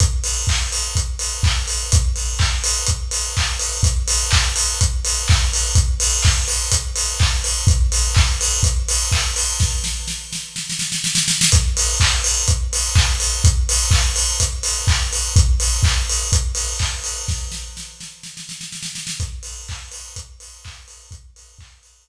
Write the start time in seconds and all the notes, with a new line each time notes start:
0.00 kick, closed hi-hat
0.24 open hi-hat
0.47 kick, clap
0.72 open hi-hat
0.95 kick, closed hi-hat
1.19 open hi-hat
1.43 kick, clap
1.68 open hi-hat
1.92 kick, closed hi-hat
2.16 open hi-hat
2.39 kick, clap
2.64 open hi-hat
2.87 kick, closed hi-hat
3.11 open hi-hat
3.37 kick, clap
3.60 open hi-hat
3.83 kick, closed hi-hat
4.08 open hi-hat
4.31 kick, clap
4.56 open hi-hat
4.81 kick, closed hi-hat
5.05 open hi-hat
5.28 kick, clap
5.53 open hi-hat
5.75 kick, closed hi-hat
6.00 open hi-hat
6.23 kick, clap
6.48 open hi-hat
6.71 kick, closed hi-hat
6.96 open hi-hat
7.20 kick, clap
7.44 open hi-hat
7.67 kick, closed hi-hat
7.92 open hi-hat
8.14 kick, clap
8.41 open hi-hat
8.63 kick, closed hi-hat
8.88 open hi-hat
9.12 kick, clap
9.36 open hi-hat
9.60 kick, snare
9.84 snare
10.08 snare
10.33 snare
10.56 snare
10.70 snare
10.79 snare
10.92 snare
11.04 snare
11.15 snare
11.28 snare
11.41 snare
11.52 kick, closed hi-hat
11.77 open hi-hat
12.00 kick, clap
12.24 open hi-hat
12.48 kick, closed hi-hat
12.73 open hi-hat
12.95 kick, clap
13.20 open hi-hat
13.44 kick, closed hi-hat
13.69 open hi-hat
13.91 kick, clap
14.16 open hi-hat
14.40 kick, closed hi-hat
14.63 open hi-hat
14.87 kick, clap
15.13 open hi-hat
15.36 kick, closed hi-hat
15.60 open hi-hat
15.83 kick, clap
16.09 open hi-hat
16.32 kick, closed hi-hat
16.55 open hi-hat
16.79 kick, clap
17.04 open hi-hat
17.28 kick, snare
17.52 snare
17.77 snare
18.00 snare
18.23 snare
18.37 snare
18.49 snare
18.61 snare
18.72 snare
18.82 snare
18.95 snare
19.07 snare
19.20 kick, closed hi-hat
19.43 open hi-hat
19.68 kick, clap
19.92 open hi-hat
20.16 kick, closed hi-hat
20.40 open hi-hat
20.64 kick, clap
20.88 open hi-hat
21.11 kick, closed hi-hat
21.36 open hi-hat
21.59 kick, clap
21.83 open hi-hat